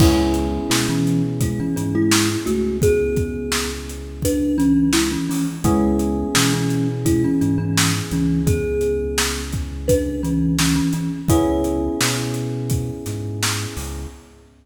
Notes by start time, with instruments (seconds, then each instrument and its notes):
0.00 synth bass 1 C#2, kalimba G#3 E4, electric piano 1 B3 C#4 E4 G#4, kick, crash
0.34 closed hi-hat
0.70 synth bass 1 B2, kalimba G#3 E4, snare
0.89 kalimba E3 C#4
1.07 closed hi-hat
1.41 kalimba G#3 E4, kick, closed hi-hat
1.60 kalimba E3 C#4
1.76 synth bass 1 G#2, kalimba E3 C#4, closed hi-hat
1.95 kalimba G#3 E4
2.11 snare
2.46 synth bass 1 C#2, kalimba A3 F#4, closed hi-hat
2.82 kalimba B3 G#4, kick, closed hi-hat
3.16 kick, closed hi-hat
3.52 snare
3.89 closed hi-hat
4.22 kalimba D4 B4, kick, closed hi-hat
4.58 kalimba E3 C#4, closed hi-hat
4.93 kalimba G#3 E4, snare
5.11 kalimba E3 C#4
5.29 kalimba E3 C#4, open hi-hat
5.64 synth bass 1 C#2, kalimba G#3 E4, electric piano 1 B3 C#4 E4 G#4, kick, closed hi-hat
5.99 closed hi-hat
6.35 synth bass 1 B2, kalimba E3 C#4, snare
6.54 kalimba E3 C#4
6.70 closed hi-hat
7.05 kalimba G#3 E4, kick, closed hi-hat
7.24 kalimba E3 C#4
7.41 synth bass 1 G#2, kalimba E3 C#4, closed hi-hat
7.58 kalimba E3 C#4
7.77 snare
8.11 synth bass 1 C#2, kalimba E3 C#4, closed hi-hat
8.47 kalimba B3 G#4, kick, closed hi-hat
8.81 closed hi-hat
9.18 snare
9.52 kick, closed hi-hat
9.88 kalimba D4 B4, kick, closed hi-hat
10.23 kalimba E3 C#4, closed hi-hat
10.59 kalimba E3 C#4, snare
10.75 kalimba E3 C#4
10.93 kalimba E3 C#4, closed hi-hat
11.28 synth bass 1 C#2, electric piano 1 B3 C#4 E4 G#4, kalimba E4 C#5, kick, closed hi-hat
11.64 closed hi-hat
12.01 synth bass 1 B2, snare
12.34 closed hi-hat
12.70 kick, closed hi-hat
13.06 synth bass 1 G#2, snare, closed hi-hat
13.43 snare
13.77 synth bass 1 C#2, open hi-hat